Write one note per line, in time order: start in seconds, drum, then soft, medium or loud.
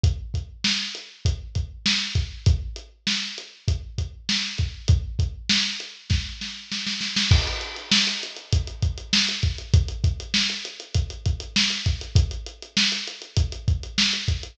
0.04 kick medium
0.04 closed hi-hat medium
0.34 kick medium
0.34 closed hi-hat medium
0.64 snare medium
0.95 closed hi-hat medium
1.25 kick medium
1.25 closed hi-hat medium
1.55 kick medium
1.55 closed hi-hat medium
1.86 snare medium
2.15 kick medium
2.15 closed hi-hat medium
2.46 kick medium
2.46 closed hi-hat medium
2.76 closed hi-hat medium
3.07 snare medium
3.38 closed hi-hat medium
3.68 kick medium
3.68 closed hi-hat medium
3.98 kick medium
3.98 closed hi-hat medium
4.29 snare medium
4.58 kick medium
4.58 closed hi-hat medium
4.88 kick medium
4.88 closed hi-hat medium
5.19 kick medium
5.19 closed hi-hat medium
5.49 snare medium
5.80 closed hi-hat medium
6.10 kick medium
6.10 snare medium
6.41 snare medium
6.72 snare medium
6.86 snare medium
7.01 snare medium
7.16 snare medium
7.31 kick medium
7.31 crash medium
7.47 closed hi-hat medium
7.61 closed hi-hat medium
7.76 closed hi-hat medium
7.92 snare loud
8.07 closed hi-hat medium
8.23 closed hi-hat medium
8.36 closed hi-hat medium
8.53 kick medium
8.53 closed hi-hat medium
8.67 closed hi-hat medium
8.82 kick medium
8.82 closed hi-hat medium
8.98 closed hi-hat medium
9.13 snare medium
9.29 closed hi-hat medium
9.43 kick medium
9.43 closed hi-hat medium
9.58 closed hi-hat medium
9.74 kick medium
9.74 closed hi-hat medium
9.88 closed hi-hat medium
10.04 kick medium
10.04 closed hi-hat medium
10.20 closed hi-hat medium
10.34 snare medium
10.50 closed hi-hat medium
10.65 closed hi-hat medium
10.80 closed hi-hat medium
10.94 kick medium
10.94 closed hi-hat medium
11.10 closed hi-hat medium
11.26 kick medium
11.26 closed hi-hat medium
11.40 closed hi-hat medium
11.56 snare medium
11.70 closed hi-hat medium
11.86 kick medium
11.86 closed hi-hat medium
12.01 closed hi-hat medium
12.16 kick medium
12.16 closed hi-hat medium
12.31 closed hi-hat medium
12.46 closed hi-hat medium
12.62 closed hi-hat medium
12.77 snare medium
12.92 closed hi-hat medium
13.07 closed hi-hat medium
13.22 closed hi-hat medium
13.37 kick medium
13.37 closed hi-hat medium
13.52 closed hi-hat medium
13.68 kick medium
13.68 closed hi-hat medium
13.83 closed hi-hat medium
13.98 snare medium
14.13 closed hi-hat medium
14.28 kick medium
14.28 closed hi-hat medium
14.43 closed hi-hat medium